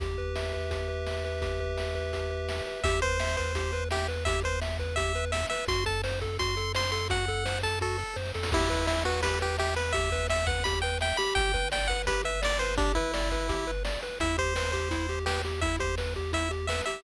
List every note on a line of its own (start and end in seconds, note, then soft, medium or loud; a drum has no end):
0.00 2.61 E2 medium
0.00 0.70 G4 medium
0.00 kick loud
0.00 closed hi-hat loud
0.18 0.53 B4 medium
0.18 kick medium
0.36 1.06 E5 medium
0.36 snare loud
0.53 0.88 B4 medium
0.53 kick medium
0.71 1.41 G4 medium
0.71 kick medium
0.71 closed hi-hat loud
0.88 1.24 B4 medium
1.07 1.77 E5 medium
1.07 snare loud
1.24 1.60 B4 medium
1.24 snare medium
1.42 2.13 G4 medium
1.42 kick loud
1.42 closed hi-hat loud
1.60 1.95 B4 medium
1.60 kick medium
1.77 2.49 E5 medium
1.77 snare loud
1.95 2.30 B4 medium
1.95 kick medium
2.13 2.80 G4 medium
2.13 kick medium
2.13 closed hi-hat loud
2.30 2.66 B4 medium
2.49 2.83 E5 medium
2.49 snare loud
2.66 2.84 B4 medium
2.66 snare medium
2.84 5.45 E2 medium
2.84 3.01 G4 loud
2.84 3.00 E5 medium
2.84 kick loud
2.84 closed hi-hat loud
3.02 3.18 B4 medium
3.02 3.36 C5 medium
3.02 kick medium
3.02 closed hi-hat medium
3.20 3.36 E5 medium
3.20 snare loud
3.37 3.53 B4 medium
3.37 3.84 C5 medium
3.37 kick loud
3.37 closed hi-hat medium
3.55 3.71 G4 medium
3.55 kick medium
3.55 closed hi-hat loud
3.73 3.89 B4 medium
3.73 closed hi-hat medium
3.91 4.07 G4 medium
3.91 4.07 E5 medium
3.91 snare loud
4.08 4.24 B4 medium
4.08 snare medium
4.08 closed hi-hat medium
4.25 4.42 G4 loud
4.25 4.40 E5 medium
4.25 kick loud
4.25 closed hi-hat loud
4.44 4.60 B4 medium
4.44 4.60 C5 medium
4.44 kick medium
4.44 closed hi-hat medium
4.62 4.78 E5 medium
4.62 snare loud
4.79 4.95 B4 medium
4.79 kick medium
4.79 closed hi-hat medium
4.96 5.13 G4 medium
4.96 5.25 E5 medium
4.96 kick loud
4.96 closed hi-hat loud
5.15 5.31 B4 medium
5.15 closed hi-hat medium
5.32 5.46 E5 medium
5.32 5.48 E5 medium
5.32 snare loud
5.50 5.67 B4 medium
5.50 5.65 E5 medium
5.50 snare medium
5.50 closed hi-hat medium
5.68 8.04 F#2 medium
5.68 5.84 F#4 loud
5.68 5.85 C6 medium
5.68 kick loud
5.68 closed hi-hat loud
5.86 6.02 A4 medium
5.86 6.02 A5 medium
5.86 kick loud
5.86 closed hi-hat medium
6.04 6.20 C5 loud
6.04 snare loud
6.21 6.37 A4 medium
6.21 kick loud
6.21 closed hi-hat medium
6.39 6.55 F#4 medium
6.39 6.72 C6 medium
6.39 kick loud
6.39 closed hi-hat loud
6.57 6.73 A4 medium
6.57 closed hi-hat medium
6.75 6.91 C5 medium
6.75 6.91 C6 medium
6.75 snare loud
6.92 7.08 A4 medium
6.92 7.08 C6 medium
6.92 snare medium
6.92 closed hi-hat medium
7.10 7.26 F#4 medium
7.10 7.59 F#5 medium
7.10 kick loud
7.10 closed hi-hat loud
7.28 7.44 A4 medium
7.28 kick medium
7.28 closed hi-hat medium
7.45 7.61 C5 medium
7.45 snare loud
7.63 7.79 A4 medium
7.63 7.79 A5 medium
7.63 kick medium
7.63 closed hi-hat medium
7.81 7.97 F#4 medium
7.81 8.17 A4 medium
7.81 kick medium
7.81 snare medium
7.98 8.14 A4 medium
7.98 snare medium
8.16 8.32 F#2 medium
8.16 8.32 C5 medium
8.16 snare medium
8.25 snare medium
8.34 8.51 F2 medium
8.34 8.51 A4 medium
8.34 snare loud
8.43 snare loud
8.52 11.13 E2 medium
8.52 8.87 E4 medium
8.52 8.69 G4 loud
8.52 kick loud
8.52 crash loud
8.70 8.86 B4 medium
8.70 kick medium
8.70 closed hi-hat medium
8.87 9.04 E4 medium
8.87 9.03 E5 medium
8.87 snare loud
9.05 9.21 F#4 medium
9.05 9.22 B4 loud
9.05 closed hi-hat medium
9.23 9.39 G4 medium
9.23 9.39 B4 medium
9.23 kick loud
9.23 closed hi-hat loud
9.41 9.57 G4 medium
9.41 9.57 B4 medium
9.41 closed hi-hat medium
9.58 9.75 G4 medium
9.58 9.74 E5 medium
9.58 snare loud
9.76 9.92 B4 medium
9.76 9.93 B4 medium
9.76 snare medium
9.76 closed hi-hat medium
9.93 10.10 G4 loud
9.93 10.27 E5 medium
9.93 kick loud
9.93 closed hi-hat loud
10.12 10.28 B4 loud
10.12 kick loud
10.12 closed hi-hat medium
10.29 10.45 E5 medium
10.29 10.47 E5 medium
10.29 snare loud
10.47 10.64 B4 medium
10.47 10.64 F#5 medium
10.47 kick loud
10.47 closed hi-hat medium
10.64 10.81 G4 loud
10.64 10.79 B5 medium
10.64 kick loud
10.64 closed hi-hat loud
10.82 10.99 B4 medium
10.82 10.98 G5 medium
10.82 closed hi-hat medium
11.01 11.17 E5 loud
11.01 11.17 G5 medium
11.01 snare loud
11.17 11.52 G4 loud
11.17 11.34 B5 medium
11.17 snare medium
11.17 closed hi-hat medium
11.35 13.97 G1 medium
11.35 11.69 G5 loud
11.35 kick loud
11.35 closed hi-hat loud
11.54 11.70 B4 medium
11.54 kick loud
11.54 closed hi-hat medium
11.72 11.88 D5 medium
11.72 11.88 G5 medium
11.72 snare loud
11.88 12.05 B4 medium
11.88 12.02 F#5 medium
11.88 kick medium
11.88 closed hi-hat medium
12.07 12.24 G4 loud
12.07 12.22 B4 medium
12.07 kick loud
12.07 closed hi-hat loud
12.24 12.40 B4 medium
12.24 12.42 E5 medium
12.24 closed hi-hat medium
12.42 12.58 D5 loud
12.42 12.59 D5 medium
12.42 snare loud
12.59 12.76 B4 loud
12.59 12.75 C5 medium
12.59 snare medium
12.59 closed hi-hat medium
12.77 12.92 D4 medium
12.77 12.94 G4 loud
12.77 kick loud
12.77 closed hi-hat loud
12.95 13.71 E4 medium
12.95 13.12 B4 loud
12.95 kick loud
12.95 closed hi-hat medium
13.14 13.30 D5 medium
13.14 snare loud
13.31 13.48 B4 medium
13.31 kick medium
13.31 closed hi-hat medium
13.49 13.65 G4 medium
13.49 kick loud
13.49 closed hi-hat loud
13.67 13.83 B4 medium
13.67 closed hi-hat medium
13.85 14.01 D5 medium
13.85 snare loud
14.02 14.19 B4 medium
14.02 snare medium
14.02 closed hi-hat medium
14.20 16.82 E2 medium
14.20 14.36 E4 loud
14.20 14.37 E5 medium
14.20 kick loud
14.20 closed hi-hat loud
14.38 14.54 G4 medium
14.38 14.71 C5 medium
14.38 kick loud
14.38 closed hi-hat medium
14.56 14.72 B4 medium
14.56 snare loud
14.72 14.89 G4 medium
14.72 15.19 C5 medium
14.72 kick medium
14.72 closed hi-hat medium
14.91 15.07 E4 loud
14.91 kick medium
14.91 closed hi-hat loud
15.09 15.25 G4 medium
15.09 closed hi-hat medium
15.26 15.42 G4 medium
15.26 15.42 B4 medium
15.26 snare loud
15.44 15.61 G4 medium
15.44 snare medium
15.44 closed hi-hat medium
15.61 15.79 E4 medium
15.61 15.76 E5 medium
15.61 kick loud
15.61 closed hi-hat loud
15.79 15.95 G4 medium
15.79 15.95 C5 medium
15.79 kick loud
15.79 closed hi-hat medium
15.98 16.14 B4 medium
15.98 snare loud
16.15 16.32 G4 medium
16.15 kick medium
16.15 closed hi-hat medium
16.33 16.49 E4 medium
16.33 16.52 E5 medium
16.33 kick medium
16.33 closed hi-hat loud
16.51 16.67 G4 medium
16.51 closed hi-hat medium
16.67 16.85 B4 medium
16.67 16.82 E5 medium
16.67 snare loud
16.86 17.03 G4 medium
16.86 17.01 E5 medium
16.86 snare medium
16.86 closed hi-hat medium